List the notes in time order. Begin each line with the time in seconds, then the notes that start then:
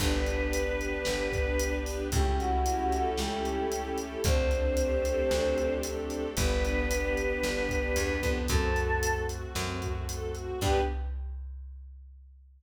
0.00 G1 B3 D4 G4 B4, kick, crash
0.25 G4, closed hi-hat
0.52 B4, closed hi-hat
0.79 D4, closed hi-hat
1.05 G1 G4, snare
1.33 B4, kick, closed hi-hat
1.59 D4, closed hi-hat
1.86 G4, open hi-hat
2.12 C#2 A3 C#4 E4 G4, kick, closed hi-hat
2.38 E4 F#4, closed hi-hat
2.65 G4, closed hi-hat
2.92 A4, closed hi-hat
3.17 C#2 C#4 G4, snare
3.45 E4, closed hi-hat
3.71 G4, closed hi-hat
3.98 A4, closed hi-hat
4.24 D2 A3 C4 D4 G4 C5, kick, closed hi-hat
4.51 D4, closed hi-hat
4.77 G4, closed hi-hat
5.05 A4, closed hi-hat
5.31 D2 C4, snare
5.58 D4, closed hi-hat
5.83 G4, closed hi-hat
6.09 A4, closed hi-hat
6.36 G1 B3 D4 G4 B4, kick, closed hi-hat
6.63 D4, closed hi-hat
6.91 G4, closed hi-hat
7.17 B3, closed hi-hat
7.43 G1 D4, snare
7.69 G4, kick, closed hi-hat
7.96 E2 B3, closed hi-hat
8.22 F2 D4, kick, closed hi-hat
8.48 F#2 A3 C4 F#4 A4, kick, closed hi-hat
8.76 F#4, closed hi-hat
9.03 A4, closed hi-hat
9.29 F#4, closed hi-hat
9.55 F#2 C4, snare
9.81 F#4, kick, closed hi-hat
10.09 A4, closed hi-hat
10.35 F#4, closed hi-hat
10.61 G2 B3 D4 G4 B4, kick, crash